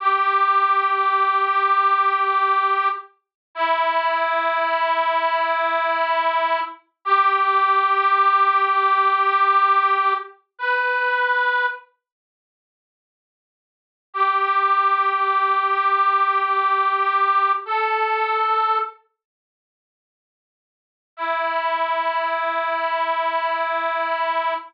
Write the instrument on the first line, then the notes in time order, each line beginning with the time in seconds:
harmonica
0.00 G4
3.55 E4
7.05 G4
10.58 B4
14.13 G4
17.65 A4
21.17 E4